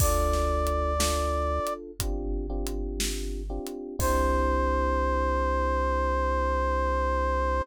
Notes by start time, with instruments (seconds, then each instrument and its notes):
0.00 synth bass 1 D2, electric piano 1 D4 F4 A4, brass section D5, kick, crash
0.33 snare
0.67 closed hi-hat
0.99 electric piano 1 D4 F4 A4, snare
1.67 closed hi-hat
2.00 synth bass 1 G1, electric piano 1 C4 D4 F4 G4, kick, closed hi-hat
2.50 electric piano 1 C4 D4 F4 G4
2.67 closed hi-hat
3.00 snare
3.50 electric piano 1 C4 D4 F4 G4
3.67 closed hi-hat
3.99 synth bass 1 C2, electric piano 1 C4 D4 E4 G4, brass section C5, kick, crash